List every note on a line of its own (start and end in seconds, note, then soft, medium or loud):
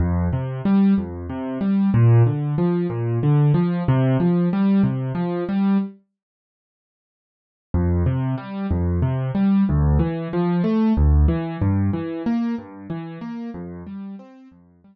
0.00 0.28 F2 medium
0.33 0.62 C3 medium
0.65 0.94 G3 medium
0.98 1.27 F2 medium
1.29 1.58 C3 medium
1.61 1.90 G3 medium
1.94 2.23 A#2 medium
2.26 2.55 D3 medium
2.58 2.87 F3 medium
2.90 3.19 A#2 medium
3.23 3.52 D3 medium
3.54 3.83 F3 medium
3.88 4.17 C3 medium
4.20 4.49 F3 medium
4.53 4.82 G3 medium
4.83 5.12 C3 medium
5.15 5.44 F3 medium
5.49 5.78 G3 medium
7.74 8.03 F2 medium
8.06 8.35 C3 medium
8.38 8.67 G3 medium
8.71 9.00 F2 medium
9.02 9.31 C3 medium
9.35 9.64 G3 medium
9.69 9.98 D2 medium
9.99 10.28 E3 medium
10.33 10.62 F3 medium
10.64 10.93 A3 medium
10.97 11.26 D2 medium
11.28 11.57 E3 medium
11.62 11.91 G2 medium
11.93 12.22 E3 medium
12.26 12.55 A#3 medium
12.58 12.87 G2 medium
12.90 13.19 E3 medium
13.21 13.50 A#3 medium
13.54 13.83 F2 medium
13.87 14.16 G3 medium
14.19 14.48 C4 medium
14.51 14.81 F2 medium
14.84 14.95 G3 medium